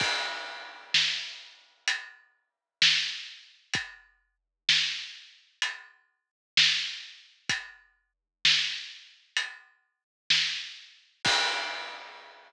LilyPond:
\new DrumStaff \drummode { \time 4/4 \tempo 4 = 64 <cymc bd>4 sn4 hh4 sn4 | <hh bd>4 sn4 hh4 sn4 | <hh bd>4 sn4 hh4 sn4 | <cymc bd>4 r4 r4 r4 | }